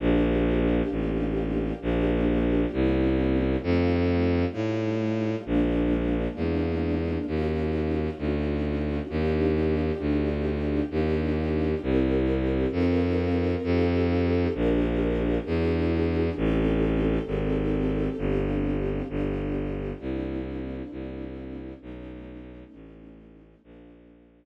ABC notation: X:1
M:4/4
L:1/8
Q:1/4=66
K:Bb
V:1 name="String Ensemble 1"
[B,DFG]4 [B,DFG]2 [B,C_D=E]2 | [G,A,EF]4 [_A,B,DF]4 | [_DEF_G]4 [=DEF=G]4 | [DEFG]2 [C=EGB]2 [C_EFB]2 [EFGA]2 |
[DFGB]2 [D=E^F^G]2 [C_E=GA]4 | [CDFG]2 [=B,DFG]2 [_B,CD=E]4 | [A,=B,^C^D]4 [G,_B,=DF]4 |]
V:2 name="Violin" clef=bass
B,,,2 A,,,2 B,,,2 C,,2 | F,,2 A,,2 B,,,2 =E,,2 | E,,2 D,,2 E,,2 D,,2 | E,,2 C,,2 F,,2 F,,2 |
B,,,2 =E,,2 A,,,2 _A,,,2 | G,,,2 G,,,2 C,,2 C,,2 | =B,,,2 A,,,2 _B,,,2 z2 |]